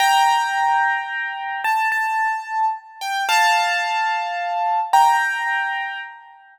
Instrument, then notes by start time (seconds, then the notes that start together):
acoustic grand piano
0.00 G5 A#5
1.64 A5
1.92 A5
3.01 G5
3.29 F5 A5
4.93 G5 A#5